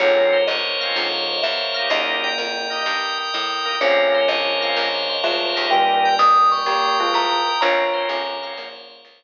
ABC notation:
X:1
M:4/4
L:1/8
Q:"Swing" 1/4=126
K:Bbdor
V:1 name="Vibraphone"
d2 e4 _f2 | e4 z4 | d2 e4 =e2 | g2 e' d'3 b2 |
b4 z4 |]
V:2 name="Tubular Bells"
[A,,F,]2 z2 [A,,F,]2 z2 | [D,B,]3 z5 | [F,D]6 [A,F]2 | [B,,G,]4 [B,G] [A,F]2 z |
[Fd]2 [F,D]2 [D,B,]2 z2 |]
V:3 name="Drawbar Organ"
[B,CDF]3 [B,CDF]4 [B,EG]- | [B,EG]3 [B,EG]4 [B,EG] | [B,CDF]3 [B,CDF]4 [B,EG]- | [B,EG]8 |
[B,CDF] [B,CDF]2 [B,CDF]5 |]
V:4 name="Drawbar Organ"
B c d f B c d f | B g B e B g e B | B c d f B c d f | B g B e B g e B |
B c d f B c d z |]
V:5 name="Electric Bass (finger)" clef=bass
B,,,2 G,,,2 B,,,2 =E,,2 | E,,2 F,,2 G,,2 =A,,2 | B,,,2 G,,,2 B,,,2 =D,, E,,- | E,,2 F,,2 B,,2 =A,,2 |
B,,,2 G,,,2 B,,,2 D,,2 |]